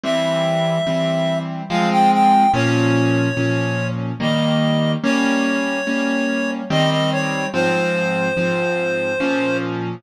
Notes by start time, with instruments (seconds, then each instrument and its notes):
0.03 acoustic grand piano E3 G3 C4, clarinet E5
0.87 acoustic grand piano E3 G3 C4
1.69 acoustic grand piano F3 G#3 C4, clarinet F5
1.91 clarinet G5
2.12 clarinet G5
2.53 acoustic grand piano A#2 F3 C#4, clarinet C#5
3.37 acoustic grand piano A#2 F3 C#4
4.20 acoustic grand piano D#3 G3 A#3, clarinet D#5
5.03 acoustic grand piano G3 A#3 C#4, clarinet C#5
5.87 acoustic grand piano G3 A#3 C#4
6.70 acoustic grand piano D#3 G3 C4, clarinet D#5
6.91 clarinet D#5
7.12 clarinet C#5
7.53 acoustic grand piano G#2 F3 C4, clarinet C5
8.37 acoustic grand piano G#2 F3 C4
9.20 acoustic grand piano A#2 F3 C#4